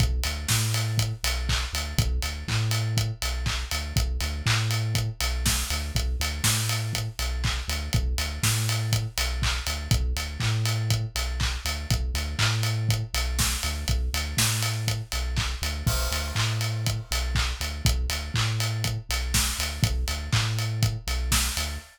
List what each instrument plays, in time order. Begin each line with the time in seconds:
0.00 synth bass 2 B1, kick, closed hi-hat
0.23 synth bass 2 D2, open hi-hat
0.48 synth bass 2 A2, kick, snare
0.74 open hi-hat
0.98 kick, closed hi-hat
1.24 synth bass 2 B1, open hi-hat
1.49 kick, clap
1.73 synth bass 2 D2, open hi-hat
1.98 synth bass 2 B1, kick, closed hi-hat
2.22 synth bass 2 D2, open hi-hat
2.48 synth bass 2 A2, kick, clap
2.71 open hi-hat
2.97 kick, closed hi-hat
3.22 synth bass 2 B1, open hi-hat
3.46 kick, clap
3.71 synth bass 2 D2, open hi-hat
3.96 synth bass 2 B1, kick, closed hi-hat
4.20 synth bass 2 D2, open hi-hat
4.46 synth bass 2 A2, kick, clap
4.71 open hi-hat
4.95 kick, closed hi-hat
5.20 synth bass 2 B1, open hi-hat
5.46 kick, snare
5.70 synth bass 2 D2, open hi-hat
5.95 synth bass 2 B1, kick, closed hi-hat
6.20 synth bass 2 D2, open hi-hat
6.44 synth bass 2 A2, kick, snare
6.69 open hi-hat
6.93 kick, closed hi-hat
7.19 synth bass 2 B1, open hi-hat
7.44 kick, clap
7.68 synth bass 2 D2, open hi-hat
7.93 synth bass 2 B1, kick, closed hi-hat
8.18 synth bass 2 D2, open hi-hat
8.43 synth bass 2 A2, kick, snare
8.69 open hi-hat
8.92 kick, closed hi-hat
9.18 synth bass 2 B1, open hi-hat
9.42 kick, clap
9.67 synth bass 2 D2, open hi-hat
9.91 synth bass 2 B1, kick, closed hi-hat
10.16 synth bass 2 D2, open hi-hat
10.40 synth bass 2 A2, kick, clap
10.65 open hi-hat
10.90 kick, closed hi-hat
11.15 synth bass 2 B1, open hi-hat
11.40 kick, clap
11.65 synth bass 2 D2, open hi-hat
11.90 synth bass 2 B1, kick, closed hi-hat
12.14 synth bass 2 D2, open hi-hat
12.39 synth bass 2 A2, kick, clap
12.63 open hi-hat
12.89 kick, closed hi-hat
13.14 synth bass 2 B1, open hi-hat
13.39 kick, snare
13.63 synth bass 2 D2, open hi-hat
13.88 synth bass 2 B1, kick, closed hi-hat
14.14 synth bass 2 D2, open hi-hat
14.37 synth bass 2 A2, kick, snare
14.63 open hi-hat
14.88 kick, closed hi-hat
15.12 synth bass 2 B1, open hi-hat
15.36 kick, clap
15.62 synth bass 2 D2, open hi-hat
15.87 synth bass 2 B1, kick, crash
16.11 synth bass 2 D2, open hi-hat
16.35 synth bass 2 A2, kick, clap
16.61 open hi-hat
16.86 kick, closed hi-hat
17.11 synth bass 2 B1, open hi-hat
17.35 kick, clap
17.60 synth bass 2 D2, open hi-hat
17.85 synth bass 2 B1, kick, closed hi-hat
18.09 synth bass 2 D2, open hi-hat
18.34 synth bass 2 A2, kick, clap
18.60 open hi-hat
18.84 kick, closed hi-hat
19.09 synth bass 2 B1, open hi-hat
19.34 kick, snare
19.59 synth bass 2 D2, open hi-hat
19.83 synth bass 2 B1, kick, closed hi-hat
20.08 synth bass 2 D2, open hi-hat
20.33 synth bass 2 A2, kick, clap
20.59 open hi-hat
20.83 kick, closed hi-hat
21.07 synth bass 2 B1, open hi-hat
21.32 kick, snare
21.57 synth bass 2 D2, open hi-hat